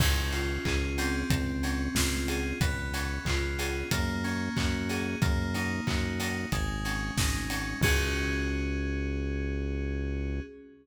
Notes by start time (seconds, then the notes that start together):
0.00 C#2 C#4, kick, crash
0.32 F4, open hi-hat
0.65 C#2 G#4, kick, clap
0.98 C4, open hi-hat
1.30 C#2, kick, closed hi-hat
1.63 C#4, open hi-hat
1.95 C#2 F4, kick, snare
2.28 G#4, open hi-hat
2.61 C#2 B3, kick, closed hi-hat
2.93 C#4, open hi-hat
3.25 C#2 F4, kick, clap
3.59 G#4, open hi-hat
3.91 F#2 A#3, kick, closed hi-hat
4.24 C#4, open hi-hat
4.56 F#2 F#4, kick, clap
4.89 G#4, open hi-hat
5.22 F#2 A#3, kick, closed hi-hat
5.54 D#4, open hi-hat
5.87 F#2 F#4, kick, clap
6.19 D#4, open hi-hat
6.52 G#1 G#3, kick, closed hi-hat
6.85 C#4, open hi-hat
7.16 G#1 D#4, kick, snare
7.50 C#4, open hi-hat
7.81 C#2 C#4 F#4 G#4, kick, crash